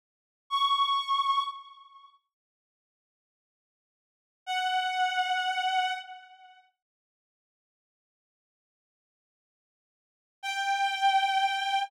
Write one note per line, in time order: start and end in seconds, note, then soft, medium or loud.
0.50 1.42 C#6 medium
4.46 5.92 F#5 medium
10.43 11.84 G5 medium